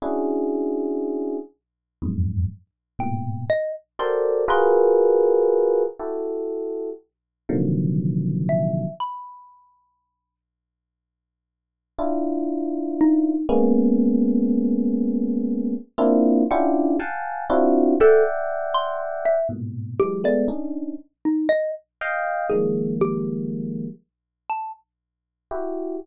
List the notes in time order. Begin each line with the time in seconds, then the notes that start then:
0.02 C#4 D4 E4 F#4 G#4
2.02 E2 F2 F#2 G#2
2.99 G#2 A2 A#2 B2 G5
3.50 D#5
3.99 F#4 G4 A4 A#4 C5 D5 C6
4.48 F4 F#4 G#4 A#4 B4 C6
5.99 E4 F#4 G4 A4
7.49 A#2 C3 D3 D#3 F3 F#3
8.49 E5
9.00 B5
11.99 D4 E4 F4
13.01 D#4
13.49 G#3 A#3 B3 C#4
15.98 A#3 C4 D4 E4 F4
16.51 C#4 D4 E4 F4 G4 F#5
16.99 F5 F#5 G5 G#5 A5
17.50 C4 D4 E4 F4 F#4
18.00 A4 D5 E5 F#5 G5
18.74 C6
19.25 E5
19.49 G#2 A2 A#2 B2
20.00 E3 F#3 G#3 G4
20.24 G#3 A3 B3 D5
20.48 C#4 D4 D#4
21.25 D#4
21.49 D#5
22.01 D#5 F5 G5
22.50 D#3 F3 G3 G#3 A#3 G#4
23.01 G4
24.50 A5
25.51 E4 F#4 G4